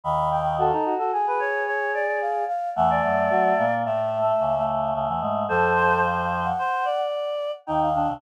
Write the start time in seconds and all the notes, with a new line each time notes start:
0.04 D#2 D#3 B5
0.31 G5
0.58 F#4 A4
0.72 D#4
0.85 F#4
0.99 F#4 A4
1.12 G#4
1.27 B4
1.40 C#5
1.67 C#5
1.94 D5
2.07 D5
2.21 F5
2.48 F5
2.76 E2 E3 A3 F#5
2.90 D5
3.04 F#2 F#3
3.30 F#3 F#4
3.58 A#2 A#3
3.85 A2 A3 E5
4.22 A3
4.40 C#2 C#3
4.58 A3
4.94 C#2 C#3 A3
5.08 E2 E3
5.21 G#2 G#3
5.49 F2 F3 A4 C5
5.75 C5
6.44 F#5
6.59 C5
6.85 D5
7.66 D#2 D#3 D#4 G5
7.81 F5
7.94 D#2 D#3 D4
8.08 C2 C3